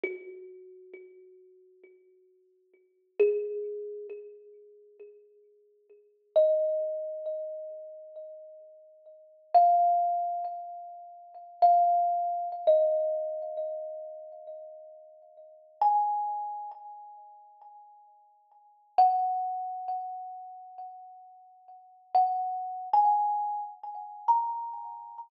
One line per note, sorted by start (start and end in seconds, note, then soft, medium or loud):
0.04 3.11 F#4 loud
3.20 4.07 G#4 loud
6.36 9.12 D#5 medium
9.54 11.44 F5 loud
11.62 12.48 F5 loud
12.67 15.54 D#5 medium
15.82 16.75 G#5 loud
18.98 21.97 F#5 loud
22.15 22.89 F#5 loud
22.93 23.61 G#5 loud
24.28 25.17 A#5 medium